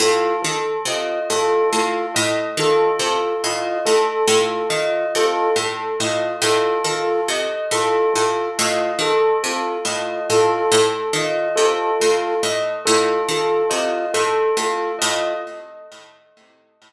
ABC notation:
X:1
M:6/4
L:1/8
Q:1/4=70
K:none
V:1 name="Pizzicato Strings" clef=bass
A,, _E, C, A,, A,, A,, E, C, A,, A,, A,, E, | C, A,, A,, A,, _E, C, A,, A,, A,, E, C, A,, | A,, A,, _E, C, A,, A,, A,, E, C, A,, A,, A,, |]
V:2 name="Flute"
F z F F F z F F F z F F | F z F F F z F F F z F F | F z F F F z F F F z F F |]
V:3 name="Tubular Bells"
A A _e A A e A A e A A e | A A _e A A e A A e A A e | A A _e A A e A A e A A e |]